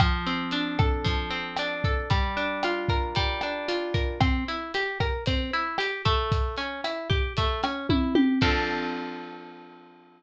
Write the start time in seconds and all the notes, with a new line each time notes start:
0.00 F3, kick, cross-stick, closed hi-hat
0.26 C4, closed hi-hat
0.51 D4, closed hi-hat
0.79 A4, kick, cross-stick, closed hi-hat
1.04 F3, kick, closed hi-hat
1.30 C4, closed hi-hat
1.56 D4, cross-stick, closed hi-hat
1.84 A4, kick, closed hi-hat
2.10 G3, kick, closed hi-hat
2.37 D4, closed hi-hat
2.63 F4, cross-stick, closed hi-hat
2.88 A#4, kick, closed hi-hat
3.15 G3, kick, closed hi-hat
3.41 D4, cross-stick, closed hi-hat
3.68 F4, closed hi-hat
3.94 A#4, kick, closed hi-hat
4.20 C4, kick, cross-stick, closed hi-hat
4.48 E4, closed hi-hat
4.74 G4, closed hi-hat
5.00 A#4, kick, cross-stick, closed hi-hat
5.26 C4, kick, closed hi-hat
5.53 E4, closed hi-hat
5.78 G4, cross-stick, closed hi-hat
6.05 A3, kick, closed hi-hat
6.32 kick, closed hi-hat
6.56 C#4, closed hi-hat
6.84 E4, cross-stick, closed hi-hat
7.10 G4, kick, closed hi-hat
7.37 A3, kick, closed hi-hat
7.63 C#4, cross-stick, closed hi-hat
7.89 E4, kick, high tom
8.15 G4, high tom
8.41 F3 C4 D4 A4, kick, crash